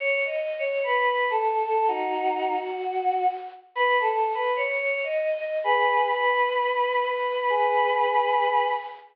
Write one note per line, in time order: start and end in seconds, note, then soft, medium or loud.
0.00 0.19 C#5 loud
0.25 0.55 D#5 medium
0.58 0.81 C#5 medium
0.83 1.06 B4 medium
1.06 1.25 B4 medium
1.30 1.63 A4 medium
1.65 1.85 A4 medium
1.88 2.54 D#4 medium
1.88 2.54 F#4 medium
2.58 3.23 F#4 medium
3.75 3.95 B4 loud
3.99 4.29 A4 medium
4.34 4.53 B4 medium
4.56 4.78 C#5 medium
4.79 4.99 C#5 medium
5.04 5.36 D#5 medium
5.38 5.57 D#5 medium
5.64 6.07 G#4 loud
5.64 6.07 B4 loud
6.10 7.02 B4 medium
7.03 7.49 B4 medium
7.50 8.66 G#4 medium
7.50 8.66 B4 loud